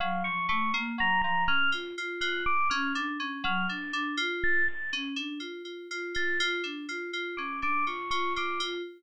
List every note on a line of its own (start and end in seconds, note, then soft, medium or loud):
0.00 0.23 F#3 loud
0.00 0.22 F5 medium
0.24 0.47 F3 medium
0.24 0.46 C#6 medium
0.49 0.71 A3 medium
0.49 0.71 C#6 medium
0.74 0.96 A#3 loud
0.98 1.20 F#3 medium
0.98 1.21 A#5 loud
1.22 1.46 F3 medium
1.22 1.44 A#5 loud
1.48 1.70 C#4 medium
1.48 1.70 F6 loud
1.72 1.94 F4 medium
1.98 2.20 F4 medium
2.21 2.43 F4 medium
2.21 2.43 F#6 medium
2.46 2.68 D6 loud
2.70 2.93 C#4 loud
2.70 2.92 F6 medium
2.95 3.17 D4 loud
3.20 3.42 C#4 medium
3.44 3.66 F#3 loud
3.44 3.67 F6 medium
3.69 3.91 D4 medium
3.69 3.91 A6 soft
3.93 4.15 D4 loud
4.17 4.62 F4 loud
4.44 4.66 A6 loud
4.68 4.90 A6 medium
4.93 5.15 C#4 loud
5.16 5.38 D4 medium
5.40 5.62 F4 medium
5.65 5.87 F4 medium
5.91 6.13 F4 medium
6.15 6.37 F4 medium
6.15 6.38 A6 medium
6.40 6.62 F4 loud
6.64 6.86 D4 medium
6.89 7.11 F4 medium
7.13 7.35 F4 medium
7.37 7.60 C#4 medium
7.37 7.59 D6 medium
7.62 7.84 D4 medium
7.62 7.85 D6 medium
7.87 8.09 F4 medium
7.87 8.09 C#6 medium
8.11 8.33 F4 medium
8.11 8.33 C#6 medium
8.36 8.58 F4 medium
8.36 8.60 D6 medium
8.60 8.82 F4 loud